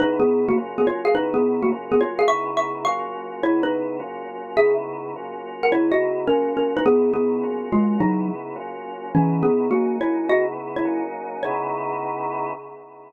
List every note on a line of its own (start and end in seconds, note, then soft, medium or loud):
0.00 0.56 C#3 medium
0.00 0.56 B3 medium
0.00 0.18 D#4 loud
0.00 0.56 D#4 medium
0.00 0.56 E4 medium
0.00 0.18 B4 loud
0.20 0.45 B3 medium
0.20 0.45 G#4 medium
0.49 0.57 A#3 medium
0.49 0.57 F#4 loud
0.57 1.14 F#3 medium
0.57 1.14 A#3 medium
0.57 1.14 C#4 medium
0.57 1.14 F4 medium
0.78 0.85 B3 medium
0.78 0.85 G#4 medium
0.87 1.07 F4 medium
0.87 1.07 C#5 medium
1.05 1.13 G#4 medium
1.05 1.13 F5 loud
1.15 1.72 C#3 medium
1.15 1.72 B3 medium
1.15 1.33 D#4 loud
1.15 1.72 D#4 medium
1.15 1.72 E4 medium
1.15 1.33 B4 loud
1.34 1.61 B3 medium
1.34 1.61 G#4 medium
1.62 1.70 A#3 medium
1.62 1.70 F#4 medium
1.72 2.29 F#3 medium
1.72 2.29 A#3 medium
1.72 2.29 C#4 medium
1.72 2.29 F4 medium
1.92 2.00 B3 medium
1.92 2.00 G#4 loud
2.01 2.19 F4 medium
2.01 2.19 C#5 loud
2.19 2.26 G#4 medium
2.19 2.26 F5 loud
2.28 2.86 C#3 medium
2.28 2.86 B3 medium
2.28 2.86 D#4 medium
2.28 2.86 E4 medium
2.28 2.55 E5 loud
2.28 2.55 C#6 loud
2.57 2.82 E5 medium
2.57 2.82 C#6 medium
2.85 3.42 F#3 medium
2.85 3.42 A#3 medium
2.85 3.42 C#4 medium
2.85 3.42 F4 medium
2.85 3.38 F5 medium
2.85 3.38 C#6 loud
3.43 4.00 C#3 medium
3.43 4.00 B3 medium
3.43 4.00 D#4 medium
3.43 3.62 E4 loud
3.43 4.00 E4 medium
3.43 3.62 C#5 loud
3.63 3.96 D#4 medium
3.63 3.96 B4 loud
4.00 4.56 F#3 medium
4.00 4.56 A#3 medium
4.00 4.56 C#4 medium
4.00 4.56 F4 medium
4.57 5.14 C#3 medium
4.57 5.14 B3 medium
4.57 5.14 D#4 medium
4.57 5.14 E4 medium
4.57 4.74 G#4 loud
4.57 4.74 E5 loud
5.16 5.73 F#3 medium
5.16 5.73 A#3 medium
5.16 5.73 C#4 medium
5.16 5.73 F4 medium
5.63 5.72 A#4 medium
5.63 5.72 F#5 medium
5.71 6.28 C#3 medium
5.71 6.28 B3 medium
5.71 6.28 D#4 medium
5.71 6.28 E4 medium
5.71 5.90 E4 medium
5.71 5.90 C#5 loud
5.92 6.26 F#4 medium
5.92 6.26 D#5 loud
6.27 6.85 F#3 medium
6.27 6.85 A#3 medium
6.27 6.54 C#4 medium
6.27 6.85 C#4 medium
6.27 6.85 F4 medium
6.27 6.54 A#4 loud
6.57 6.74 C#4 medium
6.57 6.74 A#4 medium
6.77 6.84 D#4 loud
6.77 6.84 B4 loud
6.86 7.43 C#3 medium
6.86 7.12 B3 loud
6.86 7.43 B3 medium
6.86 7.43 D#4 medium
6.86 7.43 E4 medium
6.86 7.12 G#4 loud
7.14 7.68 B3 medium
7.14 7.68 G#4 medium
7.43 8.00 F#3 medium
7.43 8.00 A#3 medium
7.43 8.00 C#4 medium
7.43 8.00 F4 medium
7.72 7.98 G#3 medium
7.72 7.98 F4 loud
8.00 8.56 C#3 medium
8.00 8.28 F#3 loud
8.00 8.56 B3 medium
8.00 8.56 D#4 medium
8.00 8.28 D#4 loud
8.00 8.56 E4 medium
8.56 9.12 F#3 medium
8.56 9.12 A#3 medium
8.56 9.12 C#4 medium
8.56 9.12 F4 medium
9.14 9.71 C#3 medium
9.14 9.42 E3 loud
9.14 9.71 B3 medium
9.14 9.42 C#4 loud
9.14 9.71 D#4 medium
9.14 9.71 E4 medium
9.43 9.68 B3 medium
9.43 9.68 G#4 medium
9.71 10.29 F#3 medium
9.71 9.96 A#3 medium
9.71 10.29 A#3 medium
9.71 10.29 C#4 medium
9.71 10.28 D#4 medium
9.71 9.96 F#4 medium
10.01 10.28 E4 medium
10.01 10.28 C#5 medium
10.29 10.85 C#3 medium
10.29 10.85 B3 medium
10.29 10.84 D#4 medium
10.29 10.85 E4 medium
10.29 10.45 F#4 loud
10.29 10.45 D#5 loud
10.76 11.03 E4 medium
10.76 11.03 C#5 medium
10.85 11.42 F#3 medium
10.85 11.42 A#3 medium
10.85 11.42 C#4 medium
10.85 11.42 D#4 medium
11.43 12.52 C#3 loud
11.43 12.52 B3 medium
11.43 12.52 D#4 loud
11.43 12.52 E4 medium
11.43 12.51 C#5 loud